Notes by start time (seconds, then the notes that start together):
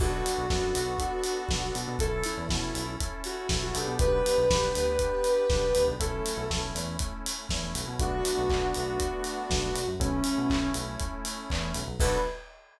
0.00 B1 B3 D4 F#4 A4, kick, crash
0.26 open hi-hat
0.38 B1
0.50 F#2 B3 D4 F#4 A4, kick, snare
0.75 B1, open hi-hat
0.99 B3 D4 F#4 A4, kick, closed hi-hat
1.24 open hi-hat
1.49 B1 B3 D4 F#4 A4, kick, snare
1.75 B2, open hi-hat
1.88 B2
1.99 B1 C#4 E4 A4, kick, closed hi-hat
2.24 E4, open hi-hat
2.37 E2
2.49 B2 C#4 E4 A4, kick, snare
2.75 B1, open hi-hat
3.00 C#4 E4 A4, kick, closed hi-hat
3.24 F#4, open hi-hat
3.49 B1 C#4 E4 A4, kick, snare
3.63 F#4
3.75 B1 B3 D4 G4 A4, open hi-hat
3.87 B2
3.99 B1 B4, kick, closed hi-hat
4.26 open hi-hat
4.38 B1
4.50 B1 B3 D4 G4, kick, snare
4.75 D2, open hi-hat
4.99 B3 D4 G4, kick, closed hi-hat
5.24 open hi-hat
5.50 B1 B3 D4 G4, kick, snare
5.75 D2, open hi-hat
5.88 B1
6.00 B1 A3 C#4 E4 A4, kick, closed hi-hat
6.26 open hi-hat
6.37 B1
6.50 B1 A3 C#4 E4, kick, snare
6.75 E2, open hi-hat
6.99 A3 C#4 E4, kick, closed hi-hat
7.26 open hi-hat
7.49 E2 A3 C#4 E4, kick, snare
7.75 B1, open hi-hat
7.87 B2
7.99 B1 A3 B3 D4 F#4, kick, closed hi-hat
8.25 open hi-hat
8.38 B1
8.50 B1, kick, clap
8.74 B1, open hi-hat
9.00 kick, closed hi-hat
9.24 open hi-hat
9.50 B1, kick, snare
9.75 B1, open hi-hat
9.88 F#2
10.00 B1 A3 C#4 E4, kick, closed hi-hat
10.24 open hi-hat
10.38 B2
10.50 B1, kick, clap
10.74 B1, open hi-hat
11.00 kick, closed hi-hat
11.25 open hi-hat
11.50 E2, kick, clap
11.74 B1, open hi-hat
11.88 B1
12.00 B1 B3 D4 F#4 A4 B4, kick, crash